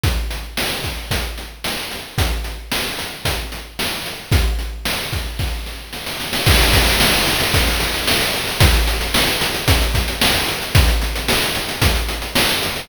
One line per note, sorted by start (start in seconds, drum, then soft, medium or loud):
0.04 kick loud
0.04 closed hi-hat medium
0.30 closed hi-hat medium
0.57 snare loud
0.84 kick medium
0.84 closed hi-hat medium
1.11 kick medium
1.11 closed hi-hat loud
1.38 closed hi-hat medium
1.64 snare medium
1.91 closed hi-hat medium
2.18 kick loud
2.18 closed hi-hat loud
2.44 closed hi-hat medium
2.72 snare loud
2.99 closed hi-hat medium
3.25 kick medium
3.25 closed hi-hat loud
3.52 closed hi-hat medium
3.79 snare medium
4.06 closed hi-hat medium
4.32 kick loud
4.32 closed hi-hat loud
4.59 closed hi-hat medium
4.85 snare loud
5.12 kick medium
5.12 closed hi-hat medium
5.39 kick medium
5.39 snare medium
5.66 snare medium
5.93 snare medium
6.06 snare medium
6.20 snare medium
6.33 snare loud
6.46 kick loud
6.46 crash loud
6.59 closed hi-hat medium
6.73 kick medium
6.73 closed hi-hat loud
6.87 closed hi-hat medium
7.00 snare loud
7.13 closed hi-hat medium
7.27 closed hi-hat medium
7.40 closed hi-hat medium
7.54 kick loud
7.54 closed hi-hat loud
7.67 closed hi-hat medium
7.80 closed hi-hat medium
7.94 closed hi-hat medium
8.07 snare loud
8.21 closed hi-hat medium
8.34 closed hi-hat medium
8.48 closed hi-hat medium
8.60 kick loud
8.60 closed hi-hat loud
8.74 closed hi-hat medium
8.87 closed hi-hat medium
9.01 closed hi-hat medium
9.14 snare loud
9.28 closed hi-hat medium
9.41 closed hi-hat loud
9.54 closed hi-hat medium
9.68 kick loud
9.68 closed hi-hat loud
9.81 closed hi-hat medium
9.94 kick medium
9.94 closed hi-hat medium
10.08 closed hi-hat medium
10.21 snare loud
10.34 closed hi-hat medium
10.48 closed hi-hat medium
10.62 closed hi-hat medium
10.75 kick loud
10.75 closed hi-hat loud
10.88 closed hi-hat medium
11.02 closed hi-hat medium
11.16 closed hi-hat medium
11.28 snare loud
11.42 closed hi-hat medium
11.55 closed hi-hat medium
11.69 closed hi-hat medium
11.82 kick loud
11.82 closed hi-hat loud
11.95 closed hi-hat medium
12.08 closed hi-hat medium
12.22 closed hi-hat medium
12.35 snare loud
12.49 closed hi-hat medium
12.63 closed hi-hat medium
12.76 open hi-hat medium